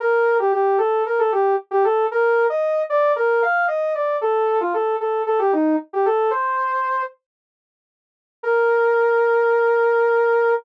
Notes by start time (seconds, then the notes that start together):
0.00 A#4
0.39 G4
0.52 G4
0.78 A4
1.06 A#4
1.19 A4
1.32 G4
1.71 G4
1.84 A4
2.11 A#4
2.50 D#5
2.90 D5
3.16 A#4
3.42 F5
3.68 D#5
3.95 D5
4.21 A4
4.61 F4
4.74 A4
5.00 A4
5.26 A4
5.39 G4
5.53 D#4
5.93 G4
6.06 A4
6.31 C5
8.43 A#4